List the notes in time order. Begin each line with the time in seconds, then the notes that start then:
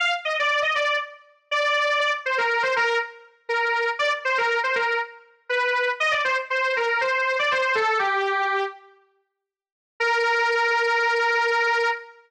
0.00 F5
0.25 D#5
0.39 D5
0.62 D#5
0.75 D5
1.51 D5
2.00 D5
2.26 C5
2.38 A#4
2.63 C5
2.76 A#4
3.49 A#4
3.99 D5
4.25 C5
4.38 A#4
4.64 C5
4.76 A#4
5.49 B4
6.00 D#5
6.11 D5
6.24 C5
6.50 C5
6.77 A#4
7.01 C5
7.39 D5
7.51 C5
7.75 A4
7.99 G4
10.00 A#4